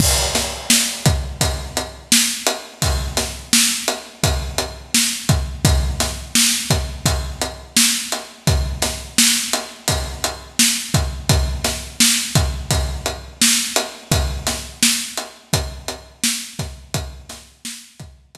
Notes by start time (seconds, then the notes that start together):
0.00 kick, crash
0.35 snare, closed hi-hat
0.70 snare
1.06 kick, closed hi-hat
1.41 kick, closed hi-hat
1.77 closed hi-hat
2.12 snare
2.47 closed hi-hat
2.82 kick, closed hi-hat
3.17 snare, closed hi-hat
3.53 snare
3.88 closed hi-hat
4.24 kick, closed hi-hat
4.58 closed hi-hat
4.94 snare
5.29 kick, closed hi-hat
5.65 kick, closed hi-hat
6.00 snare, closed hi-hat
6.35 snare
6.70 kick, closed hi-hat
7.06 kick, closed hi-hat
7.41 closed hi-hat
7.76 snare
8.12 closed hi-hat
8.47 kick, closed hi-hat
8.82 snare, closed hi-hat
9.18 snare
9.53 closed hi-hat
9.88 kick, closed hi-hat
10.24 closed hi-hat
10.59 snare
10.94 kick, closed hi-hat
11.29 kick, closed hi-hat
11.64 snare, closed hi-hat
12.00 snare
12.35 kick, closed hi-hat
12.71 kick, closed hi-hat
13.06 closed hi-hat
13.41 snare
13.76 closed hi-hat
14.11 kick, closed hi-hat
14.47 snare, closed hi-hat
14.83 snare
15.17 closed hi-hat
15.53 kick, closed hi-hat
15.88 closed hi-hat
16.24 snare
16.59 kick, snare, closed hi-hat
16.94 kick, closed hi-hat
17.29 snare, closed hi-hat
17.65 snare
18.00 kick, closed hi-hat
18.35 kick, closed hi-hat